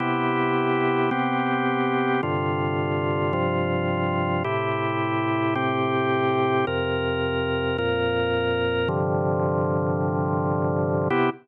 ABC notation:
X:1
M:12/8
L:1/8
Q:3/8=108
K:C
V:1 name="Drawbar Organ"
[C,B,EG]6 [C,B,CG]6 | [G,,C,D,F]6 [G,,C,F,F]6 | [A,,C,EG]6 [A,,C,CG]6 | [F,,C,_B]6 [F,,_B,,B]6 |
[G,,C,D,F,]12 | [C,B,EG]3 z9 |]